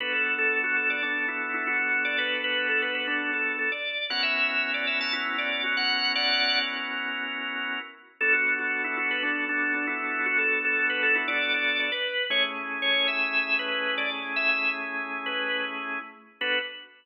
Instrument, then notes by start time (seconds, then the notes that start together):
drawbar organ
0.00 B3 D4 F#4 A4 B4
0.13 A4
0.38 A4
0.64 F#4
0.76 A4
0.90 D5
1.03 D4
1.28 E4
1.54 E4
1.67 F#4
2.05 D5
2.18 B4
2.44 B4
2.69 A4
2.82 B4
2.95 B4
3.07 D4
3.33 A4
3.59 A4
3.72 D5
4.10 B3 C#4 E4 F#4 A#4 F#5
4.23 E5
4.49 E5
4.74 D5
4.87 E5
5.01 A5
5.13 E4
5.38 D5
5.64 F#4
5.77 F#5
6.15 D5 F#5
8.21 B3 D4 F#4 A4
8.33 F#4
8.59 F#4
8.84 E4
8.97 F#4
9.11 B4
9.23 D4
9.49 D4
9.74 D4
9.87 E4
10.26 F#4
10.38 A4
10.65 A4
10.90 B4
11.03 A4
11.15 E4
11.28 D5
11.54 D5
11.80 D5
11.92 B4
12.30 A3 C#4 E4 G#4 C#5
12.82 C#5
13.08 E5
13.59 B4
13.98 D5
14.36 E5
14.49 E5
15.26 B4
16.41 B3 D4 F#4 A4 B4